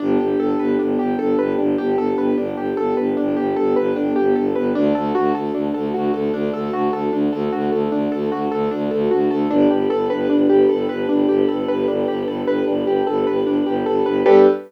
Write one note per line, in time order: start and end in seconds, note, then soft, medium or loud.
0.00 0.17 G1 loud
0.00 4.70 B3 medium
0.00 0.18 D4 loud
0.00 4.70 D4 loud
0.00 4.70 G4 medium
0.00 4.70 A4 medium
0.19 0.35 G1 medium
0.19 0.38 G4 medium
0.39 0.55 G1 medium
0.39 0.57 A4 medium
0.59 0.77 G1 medium
0.59 0.77 B4 medium
0.79 0.97 G1 medium
0.79 0.97 D4 medium
0.99 1.16 G1 medium
0.99 1.17 G4 medium
1.19 1.35 G1 medium
1.19 1.37 A4 medium
1.38 1.55 G1 medium
1.38 1.56 B4 medium
1.58 1.76 G1 loud
1.58 1.76 D4 medium
1.78 1.96 G1 medium
1.78 1.96 G4 medium
1.97 2.14 G1 medium
1.97 2.16 A4 medium
2.17 2.34 G1 medium
2.17 2.36 B4 medium
2.38 2.54 G1 medium
2.38 2.55 D4 medium
2.56 2.73 G1 medium
2.56 2.75 G4 medium
2.77 2.94 G1 medium
2.77 2.95 A4 medium
2.97 3.15 G1 medium
2.97 3.15 B4 medium
3.17 3.36 G1 medium
3.17 3.35 D4 medium
3.37 3.54 G1 medium
3.37 3.54 G4 medium
3.56 3.75 G1 medium
3.56 3.74 A4 medium
3.76 3.93 G1 medium
3.76 3.94 B4 medium
3.96 4.13 G1 medium
3.96 4.14 D4 medium
4.16 4.34 G1 medium
4.16 4.34 G4 medium
4.36 4.54 G1 medium
4.36 4.53 A4 medium
4.55 4.73 G1 medium
4.55 4.73 B4 medium
4.75 4.92 D2 loud
4.75 4.93 D4 loud
4.75 9.46 D4 medium
4.75 9.46 F#4 medium
4.75 9.46 A4 loud
4.95 5.12 D2 medium
4.95 5.13 A4 medium
5.15 5.32 D2 medium
5.15 5.33 F#4 loud
5.34 5.50 D2 medium
5.34 5.52 A4 medium
5.54 5.71 D2 medium
5.54 5.72 D4 medium
5.74 5.92 D2 medium
5.74 5.92 A4 medium
5.94 6.11 D2 medium
5.94 6.12 F#4 medium
6.13 6.30 D2 medium
6.13 6.32 A4 medium
6.33 6.50 D2 medium
6.33 6.52 D4 loud
6.53 6.70 D2 medium
6.53 6.71 A4 medium
6.72 6.89 D2 medium
6.72 6.91 F#4 medium
6.92 7.09 D2 medium
6.92 7.11 A4 medium
7.12 7.29 D2 medium
7.12 7.31 D4 medium
7.32 7.49 D2 medium
7.32 7.50 A4 medium
7.52 7.70 D2 medium
7.52 7.70 F#4 medium
7.71 7.88 D2 medium
7.71 7.90 A4 medium
7.91 8.08 D2 medium
7.91 8.10 D4 medium
8.12 8.29 D2 medium
8.12 8.30 A4 medium
8.31 8.48 D2 medium
8.31 8.50 F#4 medium
8.51 8.68 D2 medium
8.51 8.69 A4 medium
8.71 8.90 D2 medium
8.71 8.89 D4 medium
8.91 9.08 D2 loud
8.91 9.09 A4 medium
9.11 9.29 D2 medium
9.11 9.29 F#4 medium
9.30 9.47 D2 medium
9.30 9.49 A4 medium
9.50 9.67 G1 loud
9.50 9.68 D4 loud
9.50 14.21 D4 loud
9.50 14.21 G4 medium
9.50 14.21 A4 medium
9.50 14.21 B4 loud
9.70 9.87 G1 medium
9.70 9.88 G4 medium
9.90 10.08 G1 medium
9.90 10.08 A4 medium
10.10 10.28 G1 medium
10.10 10.28 B4 medium
10.30 10.48 G1 medium
10.30 10.48 D4 medium
10.49 10.66 G1 medium
10.49 10.67 G4 medium
10.69 10.87 G1 medium
10.69 10.87 A4 medium
10.89 11.06 G1 medium
10.89 11.07 B4 medium
11.09 11.26 G1 medium
11.09 11.27 D4 medium
11.28 11.45 G1 medium
11.28 11.47 G4 medium
11.49 11.66 G1 medium
11.49 11.66 A4 medium
11.68 11.86 G1 medium
11.68 11.86 B4 medium
11.88 12.05 G1 medium
11.88 12.06 D4 medium
12.08 12.25 G1 medium
12.08 12.26 G4 medium
12.27 12.44 G1 medium
12.27 12.46 A4 medium
12.46 12.63 G1 medium
12.46 12.65 B4 medium
12.67 12.84 G1 medium
12.67 12.85 D4 medium
12.85 13.02 G1 medium
12.85 13.05 G4 medium
13.07 13.24 G1 medium
13.07 13.25 A4 medium
13.27 13.44 G1 medium
13.27 13.45 B4 medium
13.45 13.61 G1 medium
13.45 13.64 D4 medium
13.66 13.83 G1 loud
13.66 13.84 G4 medium
13.86 14.03 G1 medium
13.86 14.04 A4 medium
14.06 14.23 G1 medium
14.06 14.24 B4 medium
14.26 14.47 G2 loud
14.26 14.47 B3 loud
14.26 14.47 D4 loud
14.26 14.47 G4 loud
14.26 14.47 A4 loud
14.26 14.47 B4 loud